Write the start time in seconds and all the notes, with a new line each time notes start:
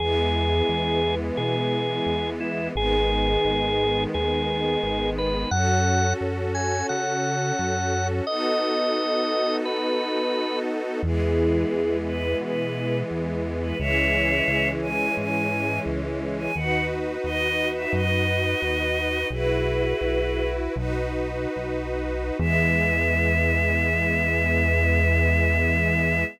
0.00 E2 E3 G#3 B3 G#4
0.69 E2
1.37 B2 G#4
2.06 E2
2.40 E4
2.75 G#1 D#3 G#3 B3 G#4
3.45 G#1
4.14 D#2 G#4
4.83 G#1
5.18 B4
5.51 F#2 C#4 F#4 A4 F#5
6.21 F#2
6.55 G#5
6.89 C#3 F#5
7.59 F#2
8.27 B3 D#4 F#4 A4 D#5
9.65 B4
11.03 E2 E3 G#3 B3 E4 G#4
11.73 E2
12.06 B4
12.41 B2 B4
13.11 E2
13.62 B4
13.78 C#2 E3 G#3 C#4 C#5 E5
14.48 C#2
14.82 G#5
15.17 G#2 G#5
15.86 C#2
16.39 G#5
16.55 D#2 D#4 F#4 B4 F#5
17.24 D#2 D#5
17.75 E5
17.93 F#2 D#5
18.62 D#2
19.30 B1 E4 F#4 G#4 B4
20.01 B1
20.76 B1 D#4 F#4 B4
21.56 B1
22.39 E2 E3 G#3 B3 E5